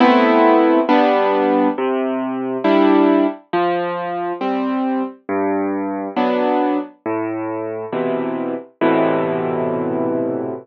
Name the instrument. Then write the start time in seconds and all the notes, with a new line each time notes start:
acoustic grand piano
0.00 A3 B3 C4 E4
0.89 G3 B3 D4
1.78 C3
2.64 G3 D4 E4
3.53 F3
4.41 G3 C4
5.29 G2
6.16 F#3 B3 D4
7.06 A2
7.93 B2 C3 E3
8.81 A2 B2 C3 E3